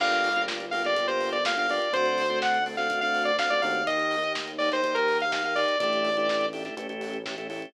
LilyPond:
<<
  \new Staff \with { instrumentName = "Lead 2 (sawtooth)" } { \time 4/4 \key g \minor \tempo 4 = 124 f''4 r8 f''16 d''8 c''8 d''16 f''16 f''16 d''8 | c''4 fis''8 r16 f''8 f''8 d''16 f''16 d''16 f''8 | ees''4 r8 d''16 c''8 bes'8 f''16 f''16 f''16 d''8 | d''4. r2 r8 | }
  \new Staff \with { instrumentName = "Drawbar Organ" } { \time 4/4 \key g \minor <bes d' f' g'>8. <bes d' f' g'>8. <bes d' f' g'>16 <bes d' f' g'>16 <bes d' f' g'>16 <bes d' f' g'>8. <bes d' f' g'>16 <bes d' f' g'>16 <bes d' f' g'>8 | <a c' d' fis'>8. <a c' d' fis'>8. <a c' d' fis'>16 <a c' d' fis'>16 <a c' d' fis'>16 <a c' d' fis'>8. <a c' d' fis'>16 <a c' d' fis'>16 <a c' d' fis'>8 | <bes ees' g'>8. <bes ees' g'>8. <bes ees' g'>16 <bes ees' g'>16 <bes ees' g'>16 <bes ees' g'>8. <bes ees' g'>16 <bes ees' g'>16 <bes ees' g'>8 | <a d' e' g'>8. <a d' e' g'>8. <a d' e' g'>16 <a d' e' g'>16 <a cis' e' g'>16 <a cis' e' g'>8. <a cis' e' g'>16 <a cis' e' g'>16 <a cis' e' g'>8 | }
  \new Staff \with { instrumentName = "Synth Bass 1" } { \clef bass \time 4/4 \key g \minor g,,1 | d,2.~ d,8 ees,8~ | ees,1 | a,,2 a,,2 | }
  \new DrumStaff \with { instrumentName = "Drums" } \drummode { \time 4/4 <cymc bd>16 hh16 hho16 hh16 <bd sn>16 hh16 hho16 <hh sn>16 <hh bd>16 hh16 hho16 hh16 <bd sn>16 hh16 hho16 hh16 | <hh bd>16 hh16 hho16 hh16 <bd sn>16 hh16 hho16 <hh sn>16 <hh bd>16 hh16 hho16 hh16 <bd sn>16 hh16 hho16 hh16 | <hh bd>16 hh16 hho16 hh16 <bd sn>16 hh16 hho16 <hh sn>16 <hh bd>16 hh16 hho16 hh16 <bd sn>16 hh16 hho16 hh16 | <hh bd>16 hh16 hho16 hh16 <bd sn>16 hh16 hho16 <hh sn>16 <hh bd>16 hh16 hho16 hh16 <bd sn>16 hh16 hho16 hh16 | }
>>